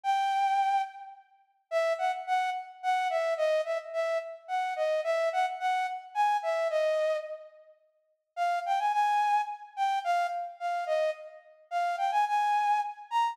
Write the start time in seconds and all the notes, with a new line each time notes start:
0.03 G5
1.71 E5
1.98 F#5
2.27 F#5
2.83 F#5
3.10 E5
3.37 D#5
3.65 E5
3.93 E5
4.48 F#5
4.76 D#5
5.04 E5
5.33 F#5
5.60 F#5
6.15 G#5
6.43 E5
6.70 D#5
8.36 F5
8.66 G5
8.79 G#5
8.93 G#5
9.76 G5
10.04 F5
10.60 F5
10.87 D#5
11.71 F5
11.98 G5
12.11 G#5
12.27 G#5
13.11 A#5